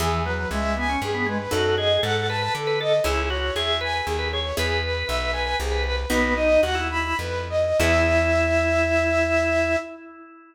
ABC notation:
X:1
M:3/4
L:1/16
Q:1/4=118
K:E
V:1 name="Flute"
G2 B2 e2 g2 G2 B2 | A2 d2 f2 a2 A2 d2 | G2 c2 e2 g2 G2 c2 | G2 B2 e2 g2 G2 B2 |
"^rit." B2 d2 f2 b2 B2 d2 | e12 |]
V:2 name="Drawbar Organ"
E,2 F,2 G,2 B, C z B, G, z | F2 G2 A2 B B z B A z | E2 F2 G2 B B z B G z | B2 B2 B2 B B z B B z |
"^rit." B,2 D2 F E3 z4 | E12 |]
V:3 name="Harpsichord"
[B,EG]12 | [DFA]12 | [CEG]12 | [B,EG]12 |
"^rit." [B,DF]12 | [B,EG]12 |]
V:4 name="Electric Bass (finger)" clef=bass
E,,4 C,,4 =G,,4 | F,,4 G,,4 =D,4 | C,,4 E,,4 D,,4 | E,,4 B,,,4 =C,,4 |
"^rit." B,,,4 D,,4 =F,,4 | E,,12 |]